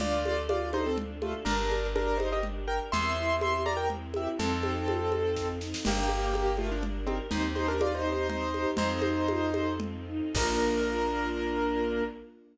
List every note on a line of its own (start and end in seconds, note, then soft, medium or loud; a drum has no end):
0.00 1.35 D2 medium
0.00 1.45 D4 medium
0.00 0.22 D4 loud
0.00 1.45 F4 medium
0.00 0.41 F4 medium
0.00 1.45 A4 medium
0.00 0.41 D5 medium
0.00 low conga medium
0.24 0.46 A4 medium
0.24 high conga medium
0.49 0.71 F4 medium
0.49 0.69 F4 medium
0.49 0.69 D5 medium
0.49 high conga medium
0.73 0.85 D#4 medium
0.73 0.95 A4 medium
0.73 0.85 C5 medium
0.73 high conga medium
0.86 0.98 C4 medium
0.86 0.98 A4 medium
0.98 1.20 D4 medium
0.98 low conga medium
1.22 1.34 A3 medium
1.22 1.34 F4 medium
1.22 1.44 A4 medium
1.22 high conga medium
1.45 2.80 G1 medium
1.45 1.87 D4 medium
1.45 1.68 D4 medium
1.45 2.91 D4 medium
1.45 2.91 G4 medium
1.45 1.87 A#4 medium
1.45 2.91 A#4 medium
1.45 low conga medium
1.71 1.93 A#4 medium
1.71 high conga medium
1.95 2.19 D4 medium
1.95 2.17 G4 medium
1.95 2.19 A#4 medium
1.95 high conga medium
2.17 2.29 D#4 medium
2.17 2.41 A#4 medium
2.17 2.29 C5 medium
2.17 high conga medium
2.32 2.44 G4 medium
2.32 2.44 D#5 medium
2.43 2.66 D4 medium
2.43 low conga medium
2.67 2.79 A#4 medium
2.67 2.90 A#4 medium
2.67 2.79 G5 medium
2.92 4.28 E2 medium
2.92 3.15 C4 loud
2.92 4.38 C4 medium
2.92 4.38 E4 medium
2.92 4.38 G4 medium
2.92 4.38 A#4 medium
2.92 3.36 E5 medium
2.92 3.36 C6 medium
2.92 low conga medium
3.17 3.39 E4 medium
3.41 3.63 G4 medium
3.41 3.62 E5 medium
3.41 3.62 C6 medium
3.41 high conga medium
3.66 3.88 A#4 medium
3.66 3.77 D5 medium
3.66 3.77 A#5 medium
3.66 high conga medium
3.77 3.88 A#4 medium
3.77 3.88 G5 medium
3.90 4.12 C4 medium
3.90 low conga medium
4.14 4.36 E4 medium
4.14 4.28 G4 medium
4.14 4.28 E5 medium
4.14 high conga medium
4.39 5.74 F2 medium
4.39 4.61 C4 medium
4.39 5.48 C4 medium
4.39 5.84 C4 medium
4.39 5.84 D#4 medium
4.39 5.84 F4 medium
4.39 5.48 A4 medium
4.39 5.84 A4 medium
4.39 low conga medium
4.63 4.85 D#4 medium
4.63 high conga medium
4.88 5.10 F4 medium
4.88 high conga medium
5.12 5.34 A4 medium
5.12 high conga medium
5.36 5.59 C4 medium
5.36 kick medium
5.36 snare medium
5.61 5.83 D#4 medium
5.61 snare medium
5.74 snare medium
5.85 7.21 G1 medium
5.85 6.33 A#3 medium
5.85 6.07 D4 medium
5.85 7.30 D4 medium
5.85 7.30 G4 medium
5.85 6.33 G4 medium
5.85 7.30 A#4 medium
5.85 crash medium
5.85 low conga loud
6.09 6.32 A#4 medium
6.09 high conga medium
6.33 6.56 A#3 medium
6.33 6.56 G4 medium
6.33 high conga medium
6.57 6.70 A3 medium
6.57 6.70 F4 medium
6.57 6.81 A#4 medium
6.57 high conga medium
6.71 6.83 F3 medium
6.71 6.83 D4 medium
6.83 7.05 D4 medium
6.83 low conga medium
7.07 7.18 D#3 medium
7.07 7.18 C4 medium
7.07 7.29 A#4 medium
7.07 high conga medium
7.31 8.66 D#2 medium
7.31 8.76 C4 medium
7.31 7.54 C4 loud
7.31 8.76 D#4 medium
7.31 7.43 D#4 medium
7.31 8.76 G4 medium
7.31 7.43 C5 medium
7.31 low conga medium
7.55 7.67 D#4 medium
7.55 7.78 G4 medium
7.55 7.67 C5 medium
7.55 high conga medium
7.68 7.80 D4 medium
7.68 7.80 A#4 medium
7.80 8.02 D#4 medium
7.80 7.97 F4 medium
7.80 7.97 D5 medium
7.80 high conga medium
7.95 8.10 D#4 medium
7.95 8.10 C5 medium
8.05 8.27 G4 medium
8.12 8.28 D#4 medium
8.12 8.28 C5 medium
8.29 8.51 C4 medium
8.29 8.71 D#4 medium
8.29 8.71 C5 medium
8.29 low conga medium
8.54 8.76 G4 medium
8.54 high conga medium
8.77 10.22 F2 medium
8.77 9.00 C4 loud
8.77 10.34 C4 medium
8.77 9.74 D#4 medium
8.77 10.34 D#4 medium
8.77 10.34 F4 medium
8.77 10.34 A4 medium
8.77 9.74 C5 medium
8.77 low conga medium
9.02 9.25 D#4 medium
9.02 high conga medium
9.28 9.51 F4 medium
9.28 high conga medium
9.54 9.78 A4 medium
9.54 high conga medium
9.80 10.05 C4 medium
9.80 low conga medium
10.07 10.32 D#4 medium
10.35 12.02 A#1 medium
10.35 12.02 A#3 loud
10.35 12.03 A#3 loud
10.35 12.02 D4 loud
10.35 12.03 D4 loud
10.35 12.02 F4 loud
10.35 12.03 F4 loud
10.35 12.04 A#4 loud
10.35 kick loud
10.35 crash loud